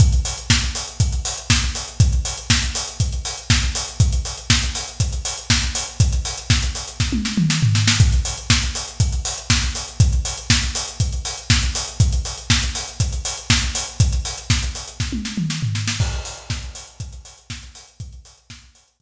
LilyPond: \new DrumStaff \drummode { \time 4/4 \tempo 4 = 120 <hh bd>16 hh16 hho16 hh16 <bd sn>16 hh16 hho16 hh16 <hh bd>16 hh16 hho16 hh16 <bd sn>16 hh16 hho16 hh16 | <hh bd>16 hh16 hho16 hh16 <bd sn>16 hh16 hho16 hh16 <hh bd>16 hh16 hho16 hh16 <bd sn>16 hh16 hho16 hh16 | <hh bd>16 hh16 hho16 hh16 <bd sn>16 hh16 hho16 hh16 <hh bd>16 hh16 hho16 hh16 <bd sn>16 hh16 hho16 hh16 | <hh bd>16 hh16 hho16 hh16 <bd sn>16 hh16 hho16 hh16 <bd sn>16 tommh16 sn16 toml16 sn16 tomfh16 sn16 sn16 |
<hh bd>16 hh16 hho16 hh16 <bd sn>16 hh16 hho16 hh16 <hh bd>16 hh16 hho16 hh16 <bd sn>16 hh16 hho16 hh16 | <hh bd>16 hh16 hho16 hh16 <bd sn>16 hh16 hho16 hh16 <hh bd>16 hh16 hho16 hh16 <bd sn>16 hh16 hho16 hh16 | <hh bd>16 hh16 hho16 hh16 <bd sn>16 hh16 hho16 hh16 <hh bd>16 hh16 hho16 hh16 <bd sn>16 hh16 hho16 hh16 | <hh bd>16 hh16 hho16 hh16 <bd sn>16 hh16 hho16 hh16 <bd sn>16 tommh16 sn16 toml16 sn16 tomfh16 sn16 sn16 |
<cymc bd>16 hh16 hho16 hh16 <bd sn>16 hh16 hho16 hh16 <hh bd>16 hh16 hho16 hh16 <bd sn>16 hh16 hho16 hh16 | <hh bd>16 hh16 hho16 hh16 <bd sn>16 hh16 hho16 hh16 <hh bd>4 r4 | }